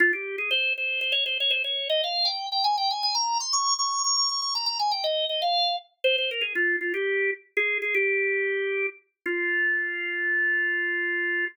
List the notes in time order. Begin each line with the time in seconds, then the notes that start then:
0.00 F4
0.13 G4
0.38 G#4
0.51 C5
0.78 C5
1.01 C5
1.12 C#5
1.26 C5
1.40 C#5
1.50 C5
1.64 C#5
1.89 D#5
2.04 F5
2.25 G5
2.52 G5
2.64 G#5
2.78 G5
2.91 G#5
3.03 G#5
3.15 A#5
3.40 C6
3.53 C#6
3.78 C#6
4.04 C#6
4.17 C#6
4.29 C#6
4.42 C#6
4.55 A#5
4.66 A#5
4.79 G#5
4.91 G5
5.04 D#5
5.29 D#5
5.42 F5
6.04 C5
6.18 C5
6.31 A#4
6.41 G#4
6.55 F4
6.81 F4
6.94 G4
7.57 G#4
7.82 G#4
7.95 G4
9.26 F4